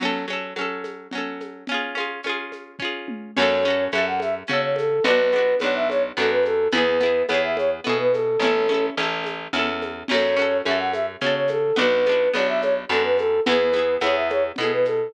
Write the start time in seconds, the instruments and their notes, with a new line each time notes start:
0.00 pizzicato strings F#3 C#4, crash, low conga, shaker
0.05 pizzicato strings A4
0.28 pizzicato strings F#3 C#4, high conga, shaker
0.33 pizzicato strings A4
0.56 pizzicato strings F#3 C#4, high conga, shaker
0.61 pizzicato strings A4
0.84 high conga, shaker
1.11 pizzicato strings F#3 C#4, low conga, shaker
1.18 pizzicato strings A4
1.40 high conga, shaker
1.67 pizzicato strings C#4, low conga, shaker
1.72 pizzicato strings F4 G#4
1.95 pizzicato strings C#4 F4, high conga, shaker
2.00 pizzicato strings G#4
2.23 pizzicato strings C#4 F4, high conga, shaker
2.29 pizzicato strings G#4
2.52 high conga, shaker
2.79 pizzicato strings C#4 F4, kick
2.85 pizzicato strings G#4
3.08 high tom
3.36 electric bass (finger) F#2, pizzicato strings C#4 F#4, flute C#5, crash, low conga, shaker
3.42 pizzicato strings A4
3.63 pizzicato strings C#4, high conga, shaker
3.68 pizzicato strings F#4 A4
3.92 electric bass (finger) F#2, pizzicato strings C#4 F#4, flute E5, high conga, shaker
3.98 pizzicato strings A4
4.07 flute F#5
4.20 flute E5, high conga, shaker
4.47 electric bass (finger) C#3, pizzicato strings C#4 F#4, flute C#5, low conga, shaker
4.53 pizzicato strings A4
4.62 flute C#5
4.76 flute A4, high conga, shaker
5.04 electric bass (finger) B1, pizzicato strings B3 D4, flute B4, low conga, shaker
5.10 pizzicato strings F#4
5.32 pizzicato strings B3, high conga, shaker
5.36 pizzicato strings D4 F#4
5.59 electric bass (finger) B1, pizzicato strings B3, flute C#5, high conga, shaker
5.64 pizzicato strings D4 F#4
5.75 flute E5
5.89 flute C#5, high conga, shaker
6.16 electric bass (finger) F#2, pizzicato strings B3 D4, flute A4, low conga, shaker
6.22 pizzicato strings F#4
6.31 flute B4
6.43 flute A4, high conga, shaker
6.71 electric bass (finger) E2, pizzicato strings B3 E4, flute B4, low conga, shaker
6.78 pizzicato strings G#4
7.01 pizzicato strings B3 E4, high conga, shaker
7.06 pizzicato strings G#4
7.28 electric bass (finger) E2, pizzicato strings B3 E4, flute C#5, high conga, shaker
7.34 pizzicato strings G#4
7.43 flute E5
7.57 flute C#5, high conga, shaker
7.84 electric bass (finger) B2, pizzicato strings B3 E4, flute A4, low conga, shaker
7.89 pizzicato strings G#4
7.99 flute B4
8.12 flute A4, high conga, shaker
8.39 electric bass (finger) A1, pizzicato strings C#4, flute A4, low conga, shaker
8.44 pizzicato strings E4 A4
8.68 pizzicato strings C#4 E4, high conga, shaker
8.74 pizzicato strings A4
8.97 electric bass (finger) A1, pizzicato strings C#4 E4, high conga, shaker
9.03 pizzicato strings A4
9.24 high conga, shaker
9.53 electric bass (finger) E2, pizzicato strings C#4 E4, low conga, shaker
9.59 pizzicato strings A4
9.82 high conga, shaker
10.08 electric bass (finger) F#2, pizzicato strings C#4 F#4, flute C#5, crash, low conga, shaker
10.14 pizzicato strings A4
10.37 pizzicato strings C#4 F#4, high conga, shaker
10.42 pizzicato strings A4
10.65 electric bass (finger) F#2, pizzicato strings C#4 F#4, flute E5, high conga, shaker
10.71 pizzicato strings A4
10.79 flute F#5
10.93 flute E5, high conga, shaker
11.21 electric bass (finger) C#3, pizzicato strings C#4 F#4, flute C#5, low conga, shaker
11.27 pizzicato strings A4
11.35 flute C#5
11.48 flute A4, high conga, shaker
11.76 electric bass (finger) B1, pizzicato strings B3 D4, flute B4, low conga, shaker
11.81 pizzicato strings F#4
12.05 pizzicato strings B3 D4, high conga, shaker
12.12 pizzicato strings F#4
12.33 electric bass (finger) B1, pizzicato strings B3 D4, flute C#5, high conga, shaker
12.39 pizzicato strings F#4
12.48 flute E5
12.61 flute C#5, high conga, shaker
12.89 electric bass (finger) F#2, pizzicato strings B3 D4, flute A4, low conga, shaker
12.94 pizzicato strings F#4
13.04 flute B4
13.18 flute A4, high conga, shaker
13.46 electric bass (finger) E2, pizzicato strings B3 E4, flute B4, low conga, shaker
13.52 pizzicato strings G#4
13.72 pizzicato strings B3 E4, high conga, shaker
13.79 pizzicato strings G#4
14.00 electric bass (finger) E2, pizzicato strings B3 E4, flute C#5, high conga, shaker
14.06 pizzicato strings G#4
14.15 flute E5
14.30 flute C#5, high conga, shaker
14.56 electric bass (finger) B2, pizzicato strings B3, flute A4, low conga, shaker
14.61 pizzicato strings E4 G#4
14.72 flute B4
14.85 flute A4, high conga, shaker